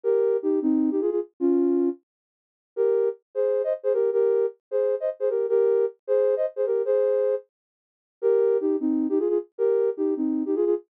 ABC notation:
X:1
M:7/8
L:1/16
Q:1/4=154
K:Ebmix
V:1 name="Ocarina"
[GB]4 [EG]2 [CE]3 [EG] [FA] [FA] z2 | [DF]6 z8 | [GB]4 z2 [Ac]3 [ce] z [Ac] [GB]2 | [GB]4 z2 [Ac]3 [ce] z [Ac] [GB]2 |
[GB]4 z2 [Ac]3 [ce] z [Ac] [GB]2 | [Ac]6 z8 | [GB]4 [EG]2 [CE]3 [EG] [FA] [FA] z2 | [GB]4 [EG]2 [CE]3 [EG] [FA] [FA] z2 |]